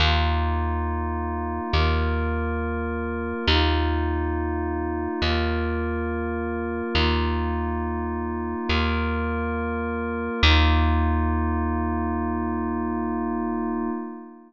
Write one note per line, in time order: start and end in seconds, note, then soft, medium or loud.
0.00 1.60 D#2 medium
0.00 1.72 A#3 medium
0.00 1.72 D#4 medium
0.00 1.72 F4 medium
1.72 3.33 D#2 medium
1.72 3.45 A#3 medium
1.72 3.45 F4 medium
1.72 3.45 A#4 medium
3.47 5.08 D#2 medium
3.47 5.20 A#3 medium
3.47 5.20 D#4 medium
3.47 5.20 F4 medium
5.22 6.82 D#2 medium
5.22 6.95 A#3 medium
5.22 6.95 F4 medium
5.22 6.95 A#4 medium
6.95 8.55 D#2 medium
6.95 8.68 A#3 medium
6.95 8.68 D#4 medium
6.95 8.68 F4 medium
8.68 10.29 D#2 medium
8.68 10.40 A#3 medium
8.68 10.40 F4 medium
8.68 10.40 A#4 medium
10.43 13.90 D#2 loud
10.43 13.90 A#3 loud
10.43 13.90 D#4 medium
10.43 13.90 F4 loud